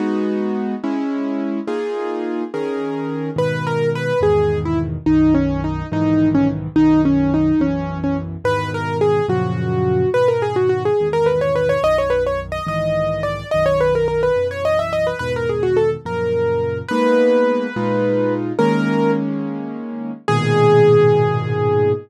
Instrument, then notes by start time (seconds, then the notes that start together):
acoustic grand piano
0.00 G#3 B3 D#4 F#4
0.84 G#3 C#4 E4
1.67 A#3 D#4 F4 G#4
2.54 D#3 C#4 G#4 A#4
3.36 G#2 B2 D#3 B4
3.67 A#4
3.95 B4
4.21 E2 G#2 B2 D#3 G#4
4.65 E4
5.06 B1 F#2 D#3 D#4
5.34 C#4
5.64 D#4
5.92 B1 G#2 D#3 E3 D#4
6.35 C#4
6.76 B1 F#2 D#3 D#4
7.05 C#4
7.34 D#4
7.60 B1 F#2 E3 C#4
8.04 C#4
8.44 E2 G#2 B2 D#3 B4
8.74 A#4
9.01 G#4
9.28 F#2 A#2 C#3 F3 F#4
10.14 G#2 B2 D#3 B4
10.28 A#4
10.42 G#4
10.56 F#4
10.69 F#4
10.85 G#4
11.00 E2 G#2 B2 D#3
11.13 A#4
11.26 B4
11.41 C#5
11.56 B4
11.69 C#5
11.83 B1 F#2 D#3 D#5
11.98 C#5
12.10 B4
12.27 C#5
12.52 D#5
12.67 B1 G#2 D#3 E3 D#5
13.23 D5
13.51 B1 F#2 D#3 D#5
13.66 C#5
13.81 B4
13.95 A#4
14.08 A#4
14.23 B4
14.36 B1 F#2 E3
14.51 C#5
14.65 D#5
14.79 E5
14.93 D#5
15.07 B4
15.19 E2 G#2 B2 D#3 B4
15.36 A#4
15.49 G#4
15.63 F#4
15.77 A4
16.05 F#2 A#2 C#3 F3 A#4
16.88 G#3 A#3 B3 D#4 B4
17.76 A#2 G#3 D#4 F4
18.59 D#3 G#3 A#3 C#4 A#4
20.28 G#2 A#2 B2 D#3 G#4